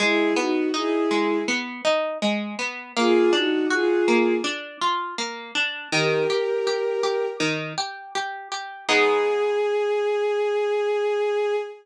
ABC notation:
X:1
M:4/4
L:1/8
Q:1/4=81
K:G#m
V:1 name="Violin"
[EG] [DF] [EG]2 z4 | [^EG] [DF] [EG]2 z4 | [=GA]4 z4 | G8 |]
V:2 name="Orchestral Harp"
G, B, D G, B, D G, B, | A, =D F A, D ^E A, D | D, =G G G D, G G G | [G,B,D]8 |]